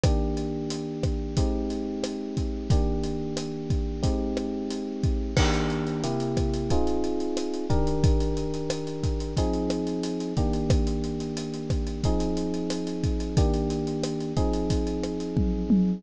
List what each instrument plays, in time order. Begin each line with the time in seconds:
0.03 electric piano 1 D#3 A#3 D4 G4, kick, cross-stick, closed hi-hat
0.37 closed hi-hat
0.70 closed hi-hat
1.03 kick, cross-stick, closed hi-hat
1.37 electric piano 1 G#3 C4 D#4 G4, kick, closed hi-hat
1.70 closed hi-hat
2.04 cross-stick, closed hi-hat
2.37 kick, closed hi-hat
2.70 electric piano 1 D#3 A#3 D4 G4, kick, closed hi-hat
3.03 closed hi-hat
3.37 cross-stick, closed hi-hat
3.70 kick, closed hi-hat
4.03 electric piano 1 G#3 C4 D#4 G4, kick, closed hi-hat
4.37 cross-stick, closed hi-hat
4.70 closed hi-hat
5.03 kick, closed hi-hat
5.37 electric piano 1 D#3 A#3 D4 G4, kick, cross-stick, crash
5.54 closed hi-hat
5.70 closed hi-hat
5.87 closed hi-hat
6.04 electric piano 1 C3 A#3 E4 G4, closed hi-hat
6.20 closed hi-hat
6.37 kick, cross-stick, closed hi-hat
6.54 closed hi-hat
6.70 electric piano 1 C4 D#4 F4 G#4, kick, closed hi-hat
6.87 closed hi-hat
7.04 closed hi-hat
7.20 closed hi-hat
7.37 cross-stick, closed hi-hat
7.54 closed hi-hat
7.70 electric piano 1 D#3 D4 G4 A#4, kick, closed hi-hat
7.87 closed hi-hat
8.04 kick, closed hi-hat
8.20 closed hi-hat
8.37 closed hi-hat
8.54 closed hi-hat
8.70 cross-stick, closed hi-hat
8.87 closed hi-hat
9.03 kick, closed hi-hat
9.20 closed hi-hat
9.37 electric piano 1 F3 C4 D#4 G#4, kick, closed hi-hat
9.53 closed hi-hat
9.70 cross-stick, closed hi-hat
9.87 closed hi-hat
10.03 closed hi-hat
10.20 closed hi-hat
10.37 electric piano 1 D#3 A#3 D4 G4, kick, closed hi-hat
10.53 closed hi-hat
10.70 kick, cross-stick, closed hi-hat
10.87 closed hi-hat
11.04 closed hi-hat
11.20 closed hi-hat
11.37 closed hi-hat
11.54 closed hi-hat
11.70 kick, cross-stick, closed hi-hat
11.87 closed hi-hat
12.03 electric piano 1 F3 C4 D#4 G#4, kick, closed hi-hat
12.20 closed hi-hat
12.37 closed hi-hat
12.54 closed hi-hat
12.70 cross-stick, closed hi-hat
12.87 closed hi-hat
13.03 kick, closed hi-hat
13.20 closed hi-hat
13.37 electric piano 1 D#3 A#3 D4 G4, kick, closed hi-hat
13.54 closed hi-hat
13.70 closed hi-hat
13.87 closed hi-hat
14.03 cross-stick, closed hi-hat
14.20 closed hi-hat
14.37 electric piano 1 F3 C4 D#4 G#4, kick, closed hi-hat
14.53 closed hi-hat
14.70 kick, closed hi-hat
14.87 closed hi-hat
15.03 cross-stick, closed hi-hat
15.20 closed hi-hat
15.37 kick, high tom
15.70 high tom